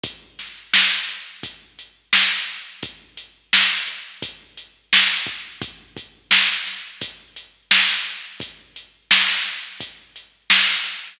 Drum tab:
HH |xx-xxx--|xx-xxx-x|xx-xxx-x|xx-xxx-x|
SD |-oo---o-|--o---o-|--oo--o-|--oo--o-|
BD |o---o---|o---o--o|oo--o---|o---o---|